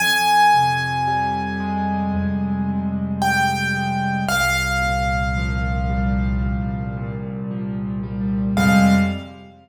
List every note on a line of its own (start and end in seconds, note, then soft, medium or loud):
0.00 2.14 F2 medium
0.00 2.83 G#5 loud
0.54 2.68 C3 medium
1.07 3.21 G3 medium
1.60 3.74 G#3 medium
2.14 4.18 F2 medium
2.68 4.21 C3 medium
3.22 4.23 G3 medium
3.22 4.24 G5 loud
3.74 4.25 G#3 medium
4.29 6.43 C2 medium
4.29 7.15 F5 loud
4.82 6.96 A#2 medium
5.37 7.50 F3 medium
5.89 8.03 G3 medium
6.43 8.47 C2 medium
6.97 8.49 A#2 medium
7.51 8.53 F3 medium
8.03 8.54 G3 medium
8.57 8.95 F2 medium
8.57 8.95 C3 loud
8.57 8.95 G3 loud
8.57 8.95 G#3 medium
8.57 8.94 F5 loud